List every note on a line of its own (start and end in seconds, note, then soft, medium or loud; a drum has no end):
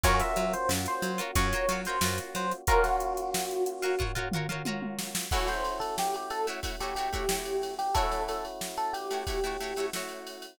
0.04 0.22 F#2 loud
0.04 2.63 A#3 medium
0.04 2.63 C#4 medium
0.04 0.56 F4 loud
0.04 2.63 F4 medium
0.04 2.63 F#4 loud
0.04 0.56 F#4 loud
0.04 0.56 A#4 loud
0.04 0.20 C#5 loud
0.04 0.56 C#5 loud
0.04 kick loud
0.04 closed hi-hat loud
0.20 0.53 E5 loud
0.20 snare medium
0.20 closed hi-hat loud
0.36 0.55 F#3 medium
0.36 closed hi-hat loud
0.53 0.69 C5 medium
0.53 closed hi-hat loud
0.69 0.87 F#2 medium
0.69 snare loud
0.86 1.20 C5 medium
0.86 closed hi-hat loud
1.02 1.20 F#3 medium
1.02 snare medium
1.02 closed hi-hat loud
1.18 1.31 F4 loud
1.18 1.31 F#4 loud
1.18 1.31 A#4 loud
1.18 1.31 C#5 loud
1.18 closed hi-hat loud
1.35 1.54 F#2 loud
1.35 1.48 F4 loud
1.35 1.48 F#4 loud
1.35 1.48 A#4 loud
1.35 1.80 C#5 loud
1.35 1.48 C#5 loud
1.35 kick loud
1.35 closed hi-hat loud
1.52 1.66 F4 loud
1.52 1.66 F#4 loud
1.52 1.66 A#4 loud
1.52 1.66 C#5 loud
1.52 snare soft
1.52 closed hi-hat loud
1.69 1.87 F#3 medium
1.69 1.82 F4 loud
1.69 1.82 F#4 loud
1.69 1.82 A#4 medium
1.69 1.82 C#5 loud
1.69 closed hi-hat loud
1.85 2.00 F4 loud
1.85 2.00 F#4 loud
1.85 2.00 A#4 loud
1.85 2.18 C5 medium
1.85 closed hi-hat loud
1.90 2.00 C#5 loud
2.01 2.20 F#2 loud
2.01 2.55 F4 loud
2.01 2.55 F#4 loud
2.01 2.55 A#4 loud
2.01 snare loud
2.05 2.55 C#5 loud
2.18 closed hi-hat loud
2.35 2.53 F#3 medium
2.35 2.52 C5 medium
2.35 closed hi-hat loud
2.52 closed hi-hat medium
2.67 5.26 A#3 medium
2.67 5.26 C#4 medium
2.67 3.21 F4 loud
2.67 5.26 F4 loud
2.67 5.26 F#4 loud
2.67 3.21 F#4 loud
2.67 2.84 A#4 loud
2.67 3.21 A#4 loud
2.67 3.21 C#5 loud
2.67 kick loud
2.67 closed hi-hat loud
2.84 4.04 F#4 medium
2.84 snare medium
2.84 closed hi-hat medium
3.00 closed hi-hat loud
3.17 closed hi-hat loud
3.34 snare loud
3.51 closed hi-hat medium
3.66 closed hi-hat loud
3.82 3.96 F4 loud
3.82 3.96 F#4 loud
3.82 3.96 A#4 loud
3.82 3.96 C#5 loud
3.82 snare soft
3.82 closed hi-hat medium
3.99 4.12 F4 loud
3.99 4.12 F#4 loud
3.99 4.12 A#4 loud
3.99 4.12 C#5 loud
3.99 kick loud
3.99 floor tom loud
4.15 4.29 F4 loud
4.15 4.29 F#4 loud
4.15 4.29 A#4 loud
4.15 4.29 C#5 loud
4.15 floor tom loud
4.32 4.47 F4 loud
4.32 4.47 F#4 loud
4.32 4.47 A#4 loud
4.32 mid tom loud
4.37 4.47 C#5 loud
4.49 4.62 F4 loud
4.49 4.62 F#4 loud
4.49 4.62 A#4 loud
4.49 4.62 C#5 loud
4.49 mid tom loud
4.65 5.18 F4 loud
4.65 5.18 F#4 loud
4.65 5.18 A#4 loud
4.65 5.18 C#5 loud
4.65 high tom loud
4.82 high tom loud
4.99 snare loud
5.15 snare loud
5.31 5.84 A3 loud
5.31 7.91 A3 medium
5.31 7.91 C#4 medium
5.31 7.91 E4 medium
5.31 5.84 E4 loud
5.31 5.48 F#4 medium
5.31 7.91 F#4 medium
5.31 5.84 F#4 loud
5.31 5.84 C#5 loud
5.31 kick loud
5.31 crash loud
5.48 5.78 C5 medium
5.48 snare medium
5.48 ride medium
5.65 ride medium
5.80 5.96 A4 medium
5.80 ride medium
5.98 6.15 G4 medium
5.98 snare loud
6.14 6.31 G4 medium
6.14 ride medium
6.30 6.46 A4 medium
6.30 ride loud
6.47 6.60 A3 loud
6.47 6.60 E4 loud
6.47 6.60 F#4 loud
6.47 6.60 C#5 medium
6.47 ride medium
6.63 6.76 A3 medium
6.63 6.76 E4 medium
6.63 6.76 F#4 medium
6.63 6.76 C#5 medium
6.63 kick loud
6.63 ride loud
6.79 6.94 A3 medium
6.79 6.94 E4 medium
6.79 6.94 F#4 loud
6.79 6.95 G4 medium
6.79 snare soft
6.79 ride medium
6.84 6.94 C#5 medium
6.95 7.09 A3 medium
6.95 7.09 E4 medium
6.95 7.09 F#4 loud
6.95 7.74 G4 medium
6.95 7.09 C#5 medium
6.95 snare soft
6.95 ride medium
7.13 7.26 A3 medium
7.13 7.26 E4 loud
7.13 7.26 F#4 loud
7.13 7.26 C#5 loud
7.13 kick loud
7.13 snare soft
7.13 ride medium
7.29 7.82 A3 medium
7.29 7.82 E4 loud
7.29 7.82 F#4 medium
7.29 7.82 C#5 loud
7.29 snare loud
7.45 ride medium
7.62 snare medium
7.62 ride medium
7.79 7.94 G4 medium
7.79 snare soft
7.79 ride medium
7.95 8.47 A3 loud
7.95 10.54 A3 medium
7.95 10.54 C#4 medium
7.95 10.54 E4 medium
7.95 8.47 E4 loud
7.95 10.54 F#4 medium
7.95 8.47 F#4 loud
7.95 8.23 A4 loud
7.95 8.47 C#5 loud
7.95 kick loud
7.95 ride loud
8.12 snare medium
8.12 ride medium
8.28 8.44 A4 medium
8.28 snare soft
8.28 ride loud
8.45 ride medium
8.61 snare loud
8.77 8.93 A4 medium
8.77 ride medium
8.93 9.87 G4 medium
8.93 ride loud
9.11 9.24 A3 medium
9.11 9.24 E4 medium
9.11 9.24 F#4 medium
9.11 9.24 C#5 medium
9.11 ride medium
9.27 9.40 A3 medium
9.27 9.40 E4 medium
9.27 9.40 F#4 medium
9.27 9.40 C#5 loud
9.27 kick loud
9.27 ride loud
9.44 9.57 A3 loud
9.44 9.57 E4 loud
9.44 9.57 F#4 medium
9.44 9.57 C#5 loud
9.44 ride medium
9.60 9.74 A3 loud
9.60 9.74 E4 medium
9.60 9.74 F#4 medium
9.60 9.74 C#5 loud
9.60 ride medium
9.76 9.90 A3 medium
9.76 9.90 E4 loud
9.76 9.90 F#4 medium
9.76 9.90 C#5 loud
9.76 snare soft
9.76 ride medium
9.93 10.46 A3 medium
9.93 10.46 E4 medium
9.93 10.46 F#4 loud
9.93 10.46 C#5 medium
9.93 snare loud
10.09 ride medium
10.27 ride loud
10.42 ride medium